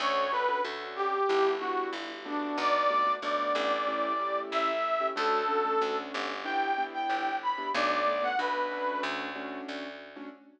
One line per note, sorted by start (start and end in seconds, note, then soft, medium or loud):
0.00 0.58 D2 loud
0.00 0.26 C#4 medium
0.00 0.26 D4 medium
0.00 0.26 F#4 loud
0.00 0.26 A4 medium
0.00 0.31 C#5 loud
0.32 0.45 C#4 medium
0.32 0.45 D4 medium
0.32 0.45 F#4 medium
0.32 0.45 A4 medium
0.32 0.61 B4 loud
0.48 0.61 C#4 medium
0.48 0.61 D4 medium
0.48 0.61 F#4 medium
0.48 0.61 A4 medium
0.65 1.22 D2 medium
0.65 1.16 C#4 medium
0.65 1.16 D4 medium
0.65 1.16 F#4 medium
0.65 1.16 A4 medium
0.96 1.50 G4 loud
1.29 1.87 G1 medium
1.29 1.55 B3 medium
1.29 1.55 D4 medium
1.29 1.55 E4 loud
1.29 1.55 G4 medium
1.59 2.13 B3 medium
1.59 2.13 D4 medium
1.59 2.13 E4 medium
1.59 1.90 F#4 medium
1.59 2.13 G4 medium
1.93 2.51 G1 medium
2.25 2.83 A3 medium
2.25 2.83 B3 medium
2.25 2.83 D4 loud
2.25 2.56 D4 medium
2.25 2.83 F#4 medium
2.58 3.16 B1 loud
2.58 3.12 D5 loud
2.90 3.03 A3 medium
2.90 3.03 B3 medium
2.90 3.03 D4 medium
2.90 3.03 F#4 medium
3.06 3.19 A3 medium
3.06 3.19 B3 medium
3.06 3.19 D4 medium
3.06 3.19 F#4 medium
3.22 3.53 B1 medium
3.22 3.74 A3 medium
3.22 3.74 B3 medium
3.22 3.74 D4 medium
3.22 3.74 F#4 medium
3.22 4.39 D5 medium
3.55 4.45 A1 loud
3.87 4.13 A3 medium
3.87 4.13 C#4 medium
3.87 4.13 E4 medium
3.87 4.13 G4 loud
4.19 4.71 A3 medium
4.19 4.71 C#4 medium
4.19 4.71 E4 medium
4.19 4.71 G4 medium
4.51 5.10 A1 medium
4.51 5.07 E5 loud
5.00 5.13 A3 medium
5.00 5.13 C#4 medium
5.00 5.13 E4 medium
5.00 5.13 G4 medium
5.16 5.75 D2 loud
5.16 5.42 A3 loud
5.16 5.42 C#4 loud
5.16 5.42 D4 medium
5.16 5.42 F#4 medium
5.16 5.96 A4 loud
5.48 5.61 A3 medium
5.48 5.61 C#4 medium
5.48 5.61 D4 medium
5.48 5.61 F#4 medium
5.65 5.78 A3 medium
5.65 5.78 C#4 medium
5.65 5.78 D4 medium
5.65 5.78 F#4 medium
5.81 6.12 D2 medium
5.81 6.32 A3 medium
5.81 6.32 C#4 medium
5.81 6.32 D4 medium
5.81 6.32 F#4 medium
6.14 7.05 G1 loud
6.44 6.71 B3 medium
6.44 6.71 D4 medium
6.44 6.71 E4 medium
6.44 6.71 G4 medium
6.44 6.84 G5 loud
6.78 7.30 B3 medium
6.78 7.30 D4 medium
6.78 7.30 E4 medium
6.78 7.30 G4 medium
6.94 7.36 G5 medium
7.09 7.68 G1 medium
7.43 7.69 B5 loud
7.58 7.71 B3 medium
7.58 7.71 D4 medium
7.58 7.71 E4 medium
7.58 7.71 G4 medium
7.74 8.33 B1 loud
7.74 8.00 A3 medium
7.74 8.00 B3 loud
7.74 8.00 D4 medium
7.74 8.00 F#4 medium
7.74 7.90 D5 loud
7.91 8.23 D5 loud
8.06 8.19 A3 medium
8.06 8.19 B3 medium
8.06 8.19 D4 medium
8.06 8.19 F#4 medium
8.23 8.36 A3 medium
8.23 8.36 B3 medium
8.23 8.36 D4 medium
8.23 8.36 F#4 medium
8.23 8.38 F#5 loud
8.39 8.97 B1 medium
8.39 8.69 A3 medium
8.39 8.69 B3 medium
8.39 8.69 D4 medium
8.39 8.69 F#4 medium
8.39 9.01 B4 medium
8.71 9.29 A3 loud
8.71 9.29 C#4 medium
8.71 9.29 D4 loud
8.71 9.29 F#4 medium
9.03 9.61 D2 loud
9.35 9.87 A3 medium
9.35 9.87 C#4 medium
9.35 9.87 D4 medium
9.35 9.87 F#4 medium
9.68 10.26 D2 medium
10.16 10.29 A3 medium
10.16 10.29 C#4 medium
10.16 10.29 D4 medium
10.16 10.29 F#4 medium